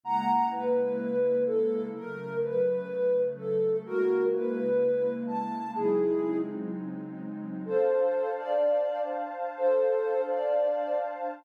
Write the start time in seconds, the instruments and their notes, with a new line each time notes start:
0.04 pad 2 (warm) C#3 G#3 A#3 E4, ocarina F#5 A#5
0.51 ocarina B4
1.46 ocarina A4
1.94 pad 2 (warm) C#3 F#3 A3, ocarina A#4
2.42 ocarina B4
3.37 ocarina A4
3.86 pad 2 (warm) C#3 G#3 A#3 E4, ocarina F#4 A#4
4.33 ocarina B4
5.27 ocarina A5
5.75 pad 2 (warm) C#3 F#3 G#3 C4 D#4, ocarina E4 G#4
7.65 pad 2 (warm) D4 C5 F5 A5, ocarina A4 C5
8.37 ocarina D5
9.57 ocarina A4 C5
10.28 ocarina D5